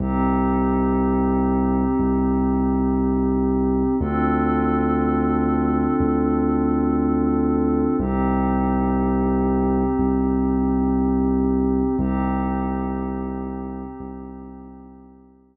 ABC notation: X:1
M:4/4
L:1/8
Q:1/4=60
K:Cdor
V:1 name="Pad 5 (bowed)"
[CEG]8 | [CDFA]8 | [CEG]8 | [CEG]8 |]
V:2 name="Synth Bass 2" clef=bass
C,,4 C,,4 | D,,4 D,,4 | C,,4 C,,4 | C,,4 C,,4 |]